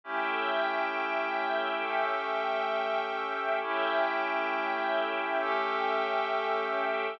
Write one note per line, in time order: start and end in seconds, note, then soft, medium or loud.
0.04 1.81 A3 medium
0.04 3.59 A3 medium
0.04 1.81 C#4 medium
0.04 3.59 C#4 medium
0.04 1.81 E4 medium
0.04 1.81 G4 medium
0.04 3.59 E5 medium
0.04 3.59 G5 medium
1.83 3.60 A3 medium
1.83 3.60 C#4 medium
1.83 3.60 G4 medium
1.83 3.60 A4 medium
3.61 5.38 A3 medium
3.61 7.16 A3 medium
3.61 5.38 C#4 medium
3.61 7.16 C#4 medium
3.61 5.38 E4 medium
3.61 5.38 G4 medium
3.61 7.16 E5 medium
3.61 7.16 G5 medium
5.41 7.18 A3 medium
5.41 7.18 C#4 medium
5.41 7.18 G4 medium
5.41 7.18 A4 medium